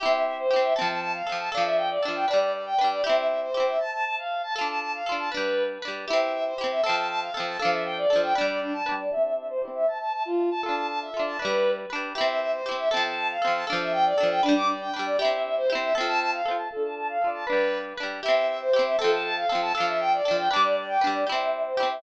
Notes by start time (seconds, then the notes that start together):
0.00 E4 G4 E5
0.06 C4
0.13 E5
0.25 E5
0.38 C5
0.51 E4 G4
0.56 C4
0.63 E5
0.76 C4 A4 A5
0.81 F3
0.89 A5
1.01 A5
1.14 F5
1.27 C4 A4
1.32 F3
1.39 A5
1.52 D4 A4 F5
1.57 F3
1.65 E5
1.77 G5
1.90 D5
2.03 D4 A4
2.08 F3
2.15 G5
2.28 D4 B4 D5
2.33 G3
2.40 D5
2.53 D5
2.66 G5
2.78 D4 B4
2.84 G3
2.91 D5
3.04 E4 G4 E5
3.09 C4
3.17 E5
3.29 E5
3.42 C5
3.54 E4 G4
3.60 C4
3.67 E5
3.80 A5
3.92 A5
4.05 A5
4.18 F5
4.43 A5
4.56 F4 A4 A5
4.61 D4
4.68 A5
4.81 A5
4.94 F5
5.06 F4 A4
5.12 D4
5.19 A5
5.32 D4 B4
5.37 G3
5.82 D4 B4
5.88 G3
6.08 E4 G4 E5
6.13 C4
6.20 E5
6.33 E5
6.46 C5
6.58 E4 G4
6.64 C4
6.71 E5
6.84 C4 A4 A5
6.89 F3
6.96 A5
7.09 A5
7.21 F5
7.34 C4 A4
7.40 F3
7.47 A5
7.59 D4 A4 F5
7.65 F3
7.72 E5
7.85 G5
7.98 D5
8.10 D4 A4
8.16 F3
8.23 G5
8.35 D4 B4 D5
8.41 G3
8.48 D5
8.61 D4
8.73 A5
8.86 D4 B4
8.92 G3
8.99 D5
9.11 E4 G4 E5
9.17 C4
9.24 E5
9.37 E5
9.49 C5
9.62 E4 G4
9.68 C4
9.75 E5
9.87 A5
10.00 A5
10.13 A5
10.25 F4
10.51 A5
10.63 F4 A4 A5
10.69 D4
10.76 A5
10.89 A5
11.01 E5
11.14 F4 A4
11.19 D4
11.26 A5
11.39 D4 B4
11.45 G3
11.90 D4 B4
11.95 G3
12.15 E4 G4 E5
12.21 C4
12.28 E5
12.41 E5
12.53 C5
12.66 E4 G4
12.71 C4
12.78 E5
12.91 C4 A4 A5
12.97 F3
13.04 A5
13.17 A5
13.29 F5
13.42 C4 A4
13.47 F3
13.54 A5
13.67 D4 A4 F5
13.73 F3
13.80 E5
13.92 G5
14.05 D5
14.18 D4 A4
14.23 F3
14.30 G5
14.43 D4 B4
14.49 G3
14.56 D6
14.68 D5
14.81 G5
14.94 D4 B4
14.99 G3
15.06 D5
15.19 E4 G4 E5
15.25 C4
15.32 E5
15.44 E5
15.57 C5
15.70 E4 G4
15.75 C4
15.82 E5
15.95 C4 A4
16.01 F3
16.07 A5
16.20 A5
16.33 F5
16.46 C4 A4
16.51 F3
16.58 A5
16.71 F4 A4
16.76 D4
16.83 A5
16.96 A5
17.09 F5
17.21 F4 A4
17.27 D4
17.34 A5
17.47 D4 B4
17.52 G3
17.97 D4 B4
18.03 G3
18.23 E4 G4 E5
18.28 C4
18.36 E5
18.48 E5
18.61 C5
18.73 E4 G4
18.79 C4
18.86 E5
18.99 C4 A4
19.04 F3
19.11 A5
19.24 A5
19.37 F5
19.49 C4 A4
19.55 F3
19.62 A5
19.75 D4 A4 F5
19.80 F3
19.87 E5
20.00 G5
20.13 D5
20.25 D4 A4
20.31 F3
20.38 G5
20.51 D4 B4 D6
20.56 G3
20.63 D5
20.76 D5
20.89 G5
21.01 D4 B4
21.07 G3
21.14 D5
21.27 E4 G4 E5
21.32 C4
21.39 E5
21.52 E5
21.65 C5
21.77 E4 G4
21.83 C4
21.90 E5